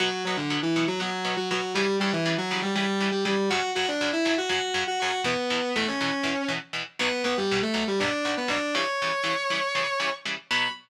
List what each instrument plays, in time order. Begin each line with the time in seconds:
0.00 overdriven guitar B2 F#3 B3, distortion guitar F#3 F#4
0.25 overdriven guitar B2 F#3 B3, distortion guitar F#3 F#4
0.37 distortion guitar D3 D4
0.50 overdriven guitar B2 F#3 B3
0.63 distortion guitar E3 E4
0.76 overdriven guitar B2 F#3 B3
0.88 distortion guitar F#3 F#4
1.00 overdriven guitar B2 F#3 B3, distortion guitar F#3 F#4
1.25 overdriven guitar B2 F#3 B3
1.37 distortion guitar F#3 F#4
1.51 overdriven guitar B2 F#3 B3, distortion guitar F#3 F#4
1.74 overdriven guitar C#3 E3 G3, distortion guitar G3 G4
2.00 overdriven guitar C#3 E3 G3, distortion guitar G3 G4
2.13 distortion guitar E3 E4
2.26 overdriven guitar C#3 E3 G3
2.38 distortion guitar F#3 F#4
2.51 overdriven guitar C#3 E3 G3
2.62 distortion guitar G3 G4
2.75 overdriven guitar C#3 E3 G3, distortion guitar G3 G4
3.01 overdriven guitar C#3 E3 G3
3.11 distortion guitar G3 G4
3.25 overdriven guitar C#3 E3 G3, distortion guitar G3 G4
3.50 overdriven guitar F#2 C#3 F#3, distortion guitar F#4 F#5
3.75 overdriven guitar F#2 C#3 F#3, distortion guitar F#4 F#5
3.88 distortion guitar D4 D5
4.01 overdriven guitar F#2 C#3 F#3
4.13 distortion guitar E4 E5
4.25 overdriven guitar F#2 C#3 F#3
4.38 distortion guitar F#4 F#5
4.49 overdriven guitar F#2 C#3 F#3, distortion guitar F#4 F#5
4.74 overdriven guitar F#2 C#3 F#3
4.87 distortion guitar F#4 F#5
4.99 overdriven guitar F#2 C#3 F#3, distortion guitar F#4 F#5
5.24 overdriven guitar E2 B2 E3, distortion guitar B3 B4
5.50 overdriven guitar E2 B2 E3
5.76 overdriven guitar E2 B2 E3, distortion guitar A3 A4
5.88 distortion guitar C#4 C#5
6.01 overdriven guitar E2 B2 E3
6.23 overdriven guitar E2 B2 E3
6.48 overdriven guitar E2 B2 E3
6.73 overdriven guitar E2 B2 E3
6.99 overdriven guitar B1 B2 F#3, distortion guitar B3 B4
7.24 overdriven guitar B1 B2 F#3, distortion guitar B3 B4
7.37 distortion guitar G3 G4
7.51 overdriven guitar B1 B2 F#3
7.62 distortion guitar A3 A4
7.74 overdriven guitar B1 B2 F#3
7.88 distortion guitar G3 G4
7.99 overdriven guitar B1 B2 F#3, distortion guitar D4 D5
8.25 overdriven guitar B1 B2 F#3
8.37 distortion guitar B3 B4
8.48 overdriven guitar B1 B2 F#3, distortion guitar D4 D5
8.74 overdriven guitar C#3 E3 G3, distortion guitar C#5 C#6
9.02 overdriven guitar C#3 E3 G3
9.24 overdriven guitar C#3 E3 G3
9.50 overdriven guitar C#3 E3 G3
9.75 overdriven guitar C#3 E3 G3
10.00 overdriven guitar C#3 E3 G3
10.25 overdriven guitar C#3 E3 G3
10.51 overdriven guitar B2 F#3 B3, distortion guitar B5